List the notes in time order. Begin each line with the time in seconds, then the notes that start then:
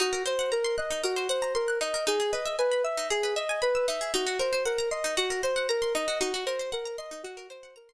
0.00 D#4 F#4
0.13 A#4
0.26 C5
0.39 F#5
0.52 A#4 A#5
0.64 C6
0.78 D#5 F#6
0.91 D#4
1.04 F#4 A#4
1.16 C5
1.29 C5 F#5
1.42 A#5
1.55 A#4 C6
1.68 F#6
1.81 D#4 D#5
1.94 A#4
2.07 D#4 G#4
2.20 G#4
2.32 B4 D#5
2.45 E5
2.59 B4 G#5
2.72 B5
2.84 E5 E6
2.97 D#4
3.10 G#4
3.23 B4
3.36 D#5 E5
3.49 G#5
3.62 B4 B5
3.75 E6
3.88 D#4 E5
4.01 G#4
4.14 D#4 F#4
4.27 F#4
4.39 A#4 C5
4.53 C5
4.65 A#4 F#5
4.78 A#5
4.91 D#5 C6
5.04 D#4
5.17 F#4
5.30 A#4
5.43 C5
5.56 F#5
5.69 A#4 A#5
5.82 C6
5.95 D#4 D#5
6.08 F#4
6.20 D#4 F#4
6.34 F#4
6.46 A#4 C5
6.59 C5
6.72 A#4 F#5
6.85 A#5
6.98 D#5 C6
7.11 D#4
7.23 F#4
7.37 A#4
7.50 C5
7.63 F#5
7.76 A#4 A#5
7.89 C6